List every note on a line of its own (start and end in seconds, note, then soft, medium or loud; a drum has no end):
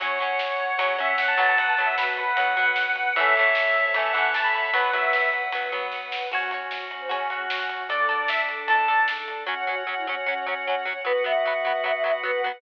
0.00 0.35 F#2 medium
0.00 0.49 F#3 medium
0.00 0.18 F#3 loud
0.00 0.18 C#4 loud
0.00 0.72 C#5 medium
0.00 1.54 C#5 medium
0.00 1.57 C#5 medium
0.00 1.54 F#5 medium
0.00 1.57 F#5 medium
0.00 kick loud
0.00 ride loud
0.19 0.75 F#3 medium
0.19 0.75 C#4 medium
0.19 ride medium
0.39 0.75 F#2 medium
0.39 snare loud
0.59 0.69 F#3 medium
0.59 ride medium
0.69 0.78 B3 medium
0.77 1.14 C#3 medium
0.77 0.97 F#3 loud
0.77 0.97 C#4 loud
0.77 0.95 C#5 medium
0.77 kick medium
0.77 ride loud
0.98 1.36 F#3 medium
0.98 1.36 C#4 loud
0.98 1.16 E5 medium
0.98 ride medium
1.18 1.54 F#2 medium
1.18 1.28 F#5 medium
1.18 snare loud
1.28 1.37 A5 medium
1.38 1.75 F#3 loud
1.38 1.75 B3 loud
1.38 1.47 A5 medium
1.38 kick medium
1.38 ride medium
1.49 1.58 A5 medium
1.57 1.94 B1 medium
1.57 1.92 B3 medium
1.57 3.15 B4 medium
1.57 3.14 B4 medium
1.57 1.68 F#5 medium
1.57 3.15 F#5 medium
1.57 3.14 F#5 medium
1.57 kick loud
1.57 ride loud
1.68 1.85 A5 medium
1.77 2.33 F#3 medium
1.77 2.33 B3 medium
1.77 ride medium
1.86 1.95 E5 medium
1.97 2.33 B1 medium
1.97 2.23 F#4 medium
1.97 2.07 B4 medium
1.97 snare loud
2.17 2.34 B4 medium
2.17 kick medium
2.17 ride medium
2.27 2.70 B4 medium
2.36 2.72 F#2 medium
2.36 2.56 F#3 medium
2.36 2.56 B3 medium
2.36 2.63 F#5 medium
2.36 kick medium
2.36 ride loud
2.57 3.11 F#3 medium
2.57 3.11 B3 medium
2.57 kick medium
2.57 ride medium
2.65 2.91 F#5 medium
2.76 2.95 B1 medium
2.76 snare loud
2.96 3.51 A1 medium
2.96 3.14 F#5 medium
2.96 ride medium
3.16 3.34 E3 loud
3.16 3.34 A3 loud
3.16 3.73 A4 medium
3.16 3.94 A4 medium
3.16 4.71 A4 medium
3.16 3.94 C#5 medium
3.16 4.71 C#5 medium
3.16 3.94 E5 medium
3.16 4.71 E5 medium
3.16 3.86 E5 medium
3.16 kick loud
3.16 ride loud
3.20 3.34 C#4 medium
3.36 3.91 E3 medium
3.36 3.91 A3 loud
3.36 ride medium
3.41 3.91 C#4 medium
3.55 3.91 A1 medium
3.55 snare loud
3.75 3.84 A4 medium
3.75 ride medium
3.85 3.94 C5 medium
3.94 4.30 E2 medium
3.94 4.12 E3 medium
3.94 4.12 A3 medium
3.94 4.12 C#4 medium
3.94 4.73 A4 medium
3.94 4.73 E5 medium
3.94 4.14 E5 medium
3.94 4.73 A5 medium
3.94 kick loud
3.94 ride loud
4.13 4.69 E3 medium
4.13 4.69 A3 medium
4.13 4.29 F#5 medium
4.13 kick medium
4.13 ride medium
4.18 4.69 C#4 medium
4.34 4.70 A1 medium
4.34 4.44 A5 medium
4.34 snare loud
4.44 4.53 B5 medium
4.54 4.63 B5 medium
4.54 ride medium
4.64 4.74 B5 medium
4.73 5.09 B1 medium
4.73 4.91 F#3 loud
4.73 4.91 B3 loud
4.73 5.23 B4 medium
4.73 6.30 B4 medium
4.73 6.28 B4 medium
4.73 4.92 B4 medium
4.73 6.30 F#5 medium
4.73 6.28 F#5 medium
4.73 kick loud
4.73 ride loud
4.93 5.48 F#3 medium
4.93 5.48 B3 medium
4.93 5.29 E5 medium
4.93 ride medium
5.13 5.49 B1 medium
5.13 snare loud
5.33 5.42 B4 medium
5.33 kick medium
5.33 ride medium
5.43 5.52 C#5 medium
5.52 5.88 F#2 medium
5.52 5.71 F#3 medium
5.52 5.71 B3 medium
5.52 kick medium
5.52 ride loud
5.72 6.27 F#3 medium
5.72 6.27 B3 medium
5.72 kick medium
5.72 ride medium
5.92 6.28 B1 medium
5.92 kick medium
5.92 snare medium
6.12 snare loud
6.31 6.67 F#2 medium
6.31 7.88 C#4 medium
6.31 7.87 C#4 medium
6.31 6.83 F#4 medium
6.31 7.88 F#4 medium
6.31 7.87 F#4 medium
6.31 6.51 F#4 medium
6.31 6.51 F#4 loud
6.31 6.51 C#5 loud
6.31 kick loud
6.31 crash loud
6.51 7.07 F#4 medium
6.51 7.07 C#5 medium
6.51 ride medium
6.71 7.07 F#2 medium
6.71 snare loud
6.91 7.00 F#4 medium
6.91 ride medium
7.00 7.10 C5 medium
7.09 7.46 C#3 medium
7.09 7.29 C#4 medium
7.09 7.27 F#4 medium
7.09 7.27 C#5 medium
7.09 kick medium
7.09 ride loud
7.30 7.81 F#4 medium
7.30 7.85 F#4 medium
7.30 7.85 C#5 medium
7.30 kick medium
7.30 ride medium
7.50 7.86 F#2 medium
7.50 snare loud
7.69 kick medium
7.69 ride medium
7.89 8.25 D2 medium
7.89 9.44 D4 medium
7.89 8.63 D4 medium
7.89 9.46 D4 medium
7.89 9.44 A4 medium
7.89 9.46 A4 medium
7.89 8.08 A4 loud
7.89 8.27 D5 medium
7.89 8.08 D5 loud
7.89 kick loud
7.89 ride loud
8.09 8.63 A4 medium
8.09 8.63 D5 medium
8.09 ride medium
8.28 8.65 D2 medium
8.28 8.38 E5 medium
8.28 snare loud
8.48 kick medium
8.48 ride medium
8.67 9.04 A2 medium
8.67 8.88 A4 medium
8.67 9.00 A5 medium
8.67 kick medium
8.67 ride loud
8.71 8.88 D5 medium
8.88 9.43 A4 medium
8.88 9.43 D5 medium
8.88 ride medium
9.08 9.26 G#2 medium
9.08 snare loud
9.28 9.45 G2 medium
9.28 ride medium
9.46 10.20 F#2 medium
9.46 9.54 F#3 loud
9.46 9.66 C#4 loud
9.46 10.90 C#4 loud
9.46 9.54 C#4 loud
9.46 10.90 F#4 loud
9.46 11.03 C#5 medium
9.46 11.03 F#5 loud
9.67 9.75 F#3 medium
9.67 9.75 C#4 medium
9.67 9.83 F#4 loud
9.87 9.95 F#3 medium
9.87 9.95 C#4 medium
9.97 10.06 E4 loud
10.06 10.15 F#3 medium
10.06 10.16 C#4 loud
10.06 10.15 C#4 medium
10.26 10.99 F#2 medium
10.26 10.34 F#3 medium
10.26 10.97 C#4 loud
10.26 10.34 C#4 medium
10.46 10.54 F#3 medium
10.46 10.54 C#4 medium
10.67 10.75 F#3 medium
10.67 10.75 C#4 medium
10.85 10.93 F#3 medium
10.85 10.93 C#4 medium
11.05 11.78 B1 medium
11.05 11.13 F#3 loud
11.05 12.48 B3 loud
11.05 11.13 B3 loud
11.05 12.48 F#4 loud
11.05 11.23 B4 loud
11.05 12.61 B4 medium
11.05 12.61 F#5 loud
11.24 11.32 F#3 medium
11.24 11.32 B3 loud
11.24 11.83 E5 loud
11.45 11.53 F#3 medium
11.45 11.53 B3 loud
11.65 11.73 F#3 medium
11.65 11.73 B3 medium
11.84 12.57 B1 medium
11.84 11.92 F#3 medium
11.84 11.92 B3 medium
11.84 11.94 E5 loud
11.94 12.04 E5 loud
12.04 12.12 F#3 medium
12.04 12.12 B3 medium
12.04 12.14 E5 loud
12.23 12.31 F#3 loud
12.23 12.31 B3 medium
12.23 12.42 B4 loud
12.44 12.52 F#3 medium
12.44 12.52 B3 medium
12.53 12.61 B4 loud